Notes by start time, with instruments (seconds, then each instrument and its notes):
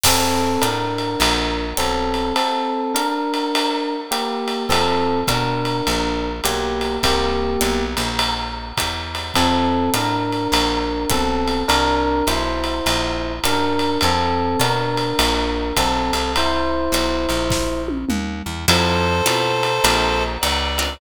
0.04 electric bass (finger) F2, electric piano 1 C4 A4, kick, crash, ride
0.62 electric bass (finger) A2, electric piano 1 D4 A#4, hi-hat pedal, ride
0.98 ride
1.20 electric bass (finger) A#1, ride
1.77 electric bass (finger) B1, electric piano 1 C4 A4, hi-hat pedal, ride
2.14 ride
2.36 electric piano 1 C4 A4, ride
2.95 electric piano 1 D4 A#4, hi-hat pedal, ride
3.34 ride
3.55 ride
4.11 electric piano 1 A#3 G4, hi-hat pedal, ride
4.48 ride
4.69 electric bass (finger) F2, electric piano 1 C4 A4, kick, ride
5.27 electric bass (finger) B2, electric piano 1 D4 A#4, kick, hi-hat pedal, ride
5.65 ride
5.87 electric bass (finger) A#1, ride
6.44 electric bass (finger) B1, electric piano 1 A#3 G4, hi-hat pedal, ride
6.81 ride
7.03 electric bass (finger) C2, electric piano 1 A#3 G4, kick, ride
7.61 electric bass (finger) B1, hi-hat pedal, ride
7.97 electric bass (finger) A#1, ride
8.19 ride
8.77 electric bass (finger) E2, kick, hi-hat pedal, ride
9.15 ride
9.34 electric bass (finger) F2, electric piano 1 C4 A4, kick, ride
9.94 electric bass (finger) A2, electric piano 1 D4 A#4, hi-hat pedal, ride
10.32 ride
10.52 electric bass (finger) A#1, ride
11.10 electric bass (finger) B1, electric piano 1 C4 A4, kick, hi-hat pedal, ride
11.48 ride
11.68 electric bass (finger) C2, electric piano 1 D4 A#4, ride
12.27 electric bass (finger) B1, electric piano 1 E4 C5, hi-hat pedal, ride
12.64 ride
12.86 electric bass (finger) A#1, ride
13.44 electric bass (finger) F#2, electric piano 1 D4 A#4, hi-hat pedal, ride
13.79 ride
14.01 electric bass (finger) F2, electric piano 1 C4 A4, ride
14.59 electric bass (finger) B2, electric piano 1 D4 A#4, hi-hat pedal, ride
14.97 ride
15.19 electric bass (finger) A#1, ride
15.76 electric bass (finger) B1, electric piano 1 C4 A4, kick, hi-hat pedal, ride
16.13 electric bass (finger) C2, ride
16.36 electric piano 1 E4 C5, ride
16.92 electric bass (finger) B1, hi-hat pedal, ride
17.29 electric bass (finger) A#1, ride
17.50 kick, snare
17.88 high tom
18.09 electric bass (finger) D#2, mid tom
18.46 electric bass (finger) E2
18.68 electric bass (finger) F2, acoustic guitar (steel) C4 E4 F4 A4, clarinet A4 C5, ride
19.26 electric bass (finger) B2, acoustic guitar (steel) C4 E4 F4 A4, hi-hat pedal, ride
19.63 ride
19.84 electric bass (finger) A#1, acoustic guitar (steel) C4 D4 F4 A#4, ride
20.41 electric bass (finger) C#2, clarinet D5, hi-hat pedal, ride
20.78 acoustic guitar (steel) C4 D4 F4 A#4, ride